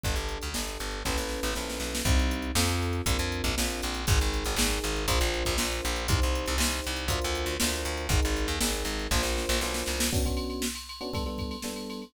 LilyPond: <<
  \new Staff \with { instrumentName = "Electric Piano 1" } { \time 4/4 \key b \minor \tempo 4 = 119 <d' g' a'>4 <d' g' a'>4 <cis' e' a' b'>4 <cis' e' a' b'>4 | \key c \minor <c' ees' g'>4 <c' f' a'>4 <c' d' f' bes'>4 <c' d' f' bes'>4 | <ees' aes' bes'>4 <ees' aes' bes'>4 <d' f' bes' c''>4 <d' f' bes' c''>4 | <ees' g' c''>4 <ees' g' c''>4 <d' f' bes' c''>4 <d' f' bes' c''>4 |
<ees' aes' bes'>4 <ees' aes' bes'>4 <d' f' bes' c''>4 <d' f' bes' c''>4 | \key b \minor <b cis' d' fis'>16 <b cis' d' fis'>4. <b cis' d' fis'>16 <g b d' a'>16 <g b d' a'>8. <g b d' a'>4 | }
  \new Staff \with { instrumentName = "Electric Bass (finger)" } { \clef bass \time 4/4 \key b \minor g,,16 g,,8 d,16 g,,8 g,,8 a,,16 a,,8 a,,16 ais,,8 b,,8 | \key c \minor c,4 f,4 bes,,16 f,8 bes,,16 bes,,8 bes,,8 | aes,,16 aes,,8 aes,,16 aes,,8 aes,,8 bes,,16 bes,,8 bes,,16 bes,,8 bes,,8 | c,16 c,8 c,16 c,8 c,8 d,16 d,8 d,16 d,8 d,8 |
aes,,16 aes,,8 ees,16 aes,,8 aes,,8 bes,,16 bes,,8 bes,,16 b,,8 c,8 | \key b \minor r1 | }
  \new DrumStaff \with { instrumentName = "Drums" } \drummode { \time 4/4 <hh bd>16 hh16 hh16 hh16 sn16 hh16 hh16 hh16 <bd sn>16 sn16 sn16 sn16 sn16 sn16 sn16 sn16 | <hh bd>16 hh16 hh16 hh16 sn16 hh16 hh16 hh16 <hh bd>16 hh16 hh16 <hh bd>16 sn16 hh16 hh16 hh16 | <hh bd>16 hh16 hh16 hh16 sn16 hh16 hh16 hh16 <hh bd>16 hh16 hh16 <hh bd>16 sn16 hh16 hh16 hh16 | <hh bd>16 hh16 hh16 hh16 sn16 hh16 hh16 hh16 <hh bd>16 hh16 hh16 hh16 sn16 hh16 hh16 hh16 |
<hh bd>16 hh16 hh16 hh16 sn16 hh16 hh16 hh16 <bd sn>16 sn16 sn16 sn16 sn16 sn16 sn16 sn16 | <cymc bd>16 <bd cymr>16 cymr16 cymr16 sn16 cymr16 cymr16 cymr16 <bd cymr>16 cymr16 <bd cymr>16 cymr16 sn16 cymr16 cymr16 cymr16 | }
>>